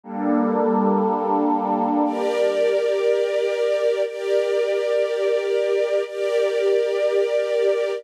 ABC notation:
X:1
M:6/8
L:1/8
Q:3/8=60
K:Gdor
V:1 name="Pad 5 (bowed)"
[G,B,DA]6 | z6 | z6 | z6 |]
V:2 name="String Ensemble 1"
z6 | [GBd]6 | [GBd]6 | [GBd]6 |]